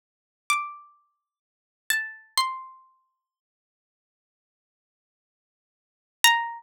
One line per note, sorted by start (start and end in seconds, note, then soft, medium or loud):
0.50 1.84 D6 medium
1.90 2.35 A5 medium
2.37 4.13 C6 medium
6.24 6.63 A#5 loud